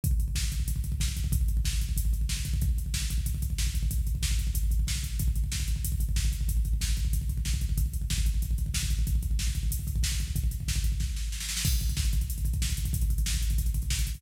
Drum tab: CC |----------------|----------------|----------------|----------------|
HH |x-x---x-x-x---x-|x-x---x-x-x---x-|x-x---x-x-x---x-|x-x---x-x-x---x-|
SD |----o-------o---|----o-------o---|----o-------o---|----o-------o---|
BD |oooooooooooooooo|oooooooooooooooo|oooooooooooooooo|ooooooooooooooo-|

CC |----------------|----------------|----------------|----------------|
HH |x-x---x-x-x---x-|x-x---x-x-x---x-|x-x---x-x-x---x-|x-x---x-x-x---x-|
SD |----o-------o---|----o-------o---|----o-------o---|----o-------o---|
BD |oooooooooooooooo|oooooooooooooooo|oooooooooooooooo|oooooooooooooooo|

CC |----------------|x---------------|----------------|
HH |x-x---x---------|-xxx-xxxxxxx-xxx|xxxx-xxxxxxx-xxo|
SD |----o---o-o-oooo|----o-------o---|----o-------o---|
BD |ooooooooo-------|oooooooo-ooooooo|oooooooooooooooo|